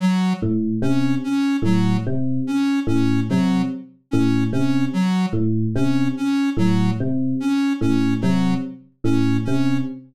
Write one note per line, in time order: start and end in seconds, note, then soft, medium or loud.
0.00 0.33 F#3 medium
0.42 0.75 A2 medium
0.82 1.15 C3 medium
0.82 1.15 C#4 medium
1.24 1.57 C#4 medium
1.62 1.95 A2 medium
1.62 1.97 F#3 medium
2.07 2.40 C3 medium
2.47 2.80 C#4 medium
2.87 3.20 A2 medium
2.87 3.20 C#4 medium
3.29 3.64 C3 medium
3.29 3.62 F#3 medium
4.11 4.46 A2 medium
4.11 4.44 C#4 medium
4.52 4.86 C3 medium
4.52 4.85 C#4 medium
4.93 5.26 F#3 medium
5.33 5.66 A2 medium
5.75 6.08 C3 medium
5.75 6.08 C#4 medium
6.17 6.50 C#4 medium
6.57 6.90 A2 medium
6.57 6.91 F#3 medium
7.00 7.33 C3 medium
7.40 7.73 C#4 medium
7.81 8.14 A2 medium
7.81 8.14 C#4 medium
8.21 8.56 C3 medium
8.21 8.54 F#3 medium
9.04 9.37 A2 medium
9.04 9.37 C#4 medium
9.45 9.80 C3 medium
9.45 9.78 C#4 medium